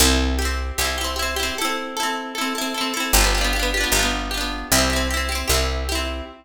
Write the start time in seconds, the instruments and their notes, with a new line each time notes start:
0.00 electric bass (finger) C2, orchestral harp E4 G4
0.05 orchestral harp C4
0.39 orchestral harp E4 G4
0.45 orchestral harp C4
0.78 electric bass (finger) C2, orchestral harp E4 G4
0.85 orchestral harp C4
0.98 orchestral harp E4 G4
1.04 orchestral harp C4
1.16 orchestral harp E4 G4
1.22 orchestral harp C4
1.36 orchestral harp E4 G4
1.43 orchestral harp C4
1.58 orchestral harp E4 A4
1.65 orchestral harp C4
1.97 orchestral harp E4 A4
2.03 orchestral harp C4
2.35 orchestral harp E4 A4
2.41 orchestral harp C4
2.55 orchestral harp E4 A4
2.61 orchestral harp C4
2.74 orchestral harp E4 A4
2.81 orchestral harp C4
2.94 orchestral harp E4 A4
3.00 orchestral harp C4
3.13 electric bass (finger) G1, orchestral harp G4
3.17 orchestral harp D4 F4
3.24 orchestral harp B3
3.35 orchestral harp F4 G4
3.41 orchestral harp B3 D4
3.53 orchestral harp F4 G4
3.59 orchestral harp B3 D4
3.74 orchestral harp F4 G4
3.80 orchestral harp B3 D4
3.92 electric bass (finger) G1, orchestral harp G4
3.96 orchestral harp D4 F4
4.02 orchestral harp B3
4.31 orchestral harp F4 G4
4.37 orchestral harp B3 D4
4.72 electric bass (finger) C2, orchestral harp E4 G4
4.78 orchestral harp C4
4.90 orchestral harp E4 G4
4.96 orchestral harp C4
5.11 orchestral harp E4 G4
5.17 orchestral harp C4
5.29 orchestral harp E4 G4
5.35 orchestral harp C4
5.48 electric bass (finger) C2, orchestral harp E4 G4
5.54 orchestral harp C4
5.89 orchestral harp E4 G4
5.95 orchestral harp C4